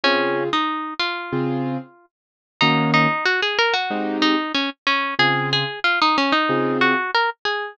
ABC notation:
X:1
M:4/4
L:1/16
Q:1/4=93
K:Ebdor
V:1 name="Acoustic Guitar (steel)"
D3 E3 F8 z2 | E2 E2 G A B G3 E2 D z D2 | A2 A2 F E D E3 G2 B z A2 |]
V:2 name="Acoustic Grand Piano"
[D,CFA]8 [D,CFA]8 | [E,B,DG]8 [A,CE=G]8 | [D,CFA]8 [D,CFA]8 |]